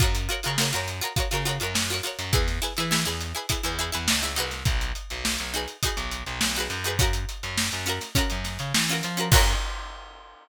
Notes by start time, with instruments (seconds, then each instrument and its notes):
0.00 electric bass (finger) F#2, pizzicato strings F4 F#4 A#4 C#5, kick, closed hi-hat
0.15 closed hi-hat
0.29 pizzicato strings F4 F#4 A#4 C#5, closed hi-hat
0.43 electric bass (finger) C#3, pizzicato strings F4 F#4 A#4, closed hi-hat
0.48 pizzicato strings C#5
0.58 pizzicato strings F4 F#4 A#4 C#5, snare
0.73 electric bass (finger) F#2, pizzicato strings F4 F#4 A#4 C#5, closed hi-hat
0.88 closed hi-hat
1.01 pizzicato strings F4 F#4 A#4 C#5, closed hi-hat
1.16 pizzicato strings F4 F#4 A#4 C#5, kick, closed hi-hat
1.31 electric bass (finger) C#3, pizzicato strings F4 F#4 A#4 C#5, snare, closed hi-hat
1.45 pizzicato strings F4 F#4 A#4 C#5, closed hi-hat
1.60 electric bass (finger) F#2, pizzicato strings F4 F#4 A#4, closed hi-hat
1.64 pizzicato strings C#5
1.74 electric bass (finger) F#2, snare
1.90 pizzicato strings F4 F#4 A#4, closed hi-hat
1.94 pizzicato strings C#5
2.03 pizzicato strings F4 F#4 A#4 C#5, closed hi-hat
2.19 electric bass (finger) F#2, closed hi-hat
2.33 electric bass (finger) E2, pizzicato strings E4 G#4 B4, kick, closed hi-hat
2.48 snare, closed hi-hat
2.62 pizzicato strings E4 G#4 B4, snare, closed hi-hat
2.77 electric bass (finger) E3, pizzicato strings E4 G#4 B4, snare, closed hi-hat
2.91 pizzicato strings E4 G#4 B4, snare
3.05 electric bass (finger) E2, pizzicato strings E4 G#4 B4, closed hi-hat
3.21 closed hi-hat
3.35 pizzicato strings E4 G#4 B4, closed hi-hat
3.49 pizzicato strings E4 G#4 B4, kick, closed hi-hat
3.63 electric bass (finger) E2, pizzicato strings E4 G#4 B4, closed hi-hat
3.79 pizzicato strings E4 G#4 B4, closed hi-hat
3.92 electric bass (finger) E2, pizzicato strings E4 G#4 B4, closed hi-hat
4.08 electric bass (finger) C#2, snare
4.22 pizzicato strings E4 G#4 B4, closed hi-hat
4.36 electric bass (finger) C2, pizzicato strings D#4 F#4 G#4 B4, closed hi-hat
4.51 snare, closed hi-hat
4.65 electric bass (finger) B1, kick, closed hi-hat
4.81 closed hi-hat
4.95 closed hi-hat
5.10 electric bass (finger) B1, closed hi-hat
5.25 snare
5.38 electric bass (finger) B1, closed hi-hat
5.54 pizzicato strings D#4 F#4 G#4 B4, closed hi-hat
5.68 closed hi-hat
5.83 pizzicato strings D#4 F#4 G#4, kick, closed hi-hat
5.87 pizzicato strings B4
5.97 electric bass (finger) B1, closed hi-hat
6.11 closed hi-hat
6.26 electric bass (finger) B1, closed hi-hat
6.41 electric bass (finger) B1, snare
6.55 pizzicato strings D#4 F#4 G#4, closed hi-hat
6.60 pizzicato strings B4
6.70 electric bass (finger) F#2, closed hi-hat
6.84 pizzicato strings D#4 F#4 G#4 B4, closed hi-hat
6.99 pizzicato strings C#4 F4 F#4 A#4, kick, closed hi-hat
7.13 closed hi-hat
7.29 closed hi-hat
7.43 electric bass (finger) F#2, closed hi-hat
7.58 snare
7.72 electric bass (finger) F#2, closed hi-hat
7.86 pizzicato strings C#4 F4 F#4 A#4, snare, closed hi-hat
8.01 snare, closed hi-hat
8.15 pizzicato strings C#4 F4 F#4 A#4, kick, closed hi-hat
8.30 electric bass (finger) F#2, closed hi-hat
8.44 snare, closed hi-hat
8.59 electric bass (finger) C#3, closed hi-hat
8.74 electric bass (finger) E3, snare
8.88 pizzicato strings C#4 F4, closed hi-hat
8.92 pizzicato strings F#4 A#4
9.03 electric bass (finger) F3, closed hi-hat
9.17 pizzicato strings C#4 F4 F#4 A#4, closed hi-hat
9.32 electric bass (finger) F#2, pizzicato strings F4 F#4 A#4 C#5, kick, crash